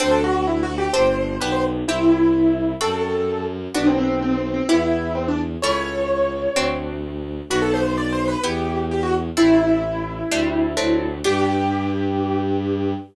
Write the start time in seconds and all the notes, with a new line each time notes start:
0.00 D2 C4 D4 F#4 A4 C5
0.11 A4
0.24 F#4
0.47 E4
0.63 F#4
0.78 G4
0.93 G1 C4 D4 G4 C5
1.41 B1 B3 D4 G4 B4
1.52 C5
1.88 C2 C4 E4 G4
2.81 F#2 C4 F#4 A4
3.74 B1 B3 D4 F#4
3.87 C4
3.98 C4
4.22 C4
4.38 C4
4.54 C4
4.69 E2 B3 E4 G4
5.15 C4
5.28 D4
5.62 C#2 A3 C#4 E4 C#5
6.55 D2 A3 C4 D4 F#4
7.50 B1 B3 D4 F#4
7.62 A4
7.74 C5
7.97 D5
8.12 C5
8.28 B4
8.44 E2 B3 E4 G4
8.91 G4
9.03 F#4
9.37 A1 A3 C4 E4
10.31 D2 G3 A3 C4 D4
10.77 D2 F#3 A3 C4 D4
11.24 G2 B3 D4 G4